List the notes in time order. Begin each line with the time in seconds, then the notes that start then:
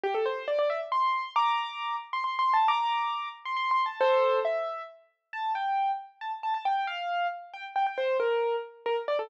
0.03 G4
0.14 A4
0.26 C5
0.48 D5
0.59 D5
0.70 E5
0.92 C6
1.36 A#5 D6
2.13 C6
2.24 C6
2.39 C6
2.53 A5
2.68 A#5 D6
3.45 C6
3.57 C6
3.71 C6
3.86 A5
4.00 A4 C5
4.45 E5
5.33 A5
5.55 G5
6.21 A5
6.43 A5
6.54 A5
6.65 G5
6.87 F5
7.53 G5
7.76 G5
7.86 G5
7.98 C5
8.20 A#4
8.86 A#4
9.08 D5
9.19 A4